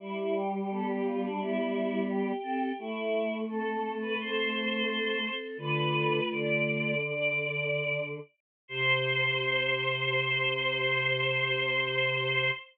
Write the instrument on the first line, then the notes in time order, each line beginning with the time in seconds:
choir aahs
0.00 G3 E4
0.17 E4
0.35 G4
0.52 G4
0.70 B3 G4 A4
0.87 G4
1.04 F4
1.23 D4
1.39 B3 E4 G4
2.09 G4
2.43 C4 A4
2.79 A3 E4
3.49 C4 A4
4.01 B4
4.19 C4 A4 C5
5.24 C4 A4
5.57 D3 A3 F4 B4
6.29 D3 D5
7.05 D5
8.68 C3 C5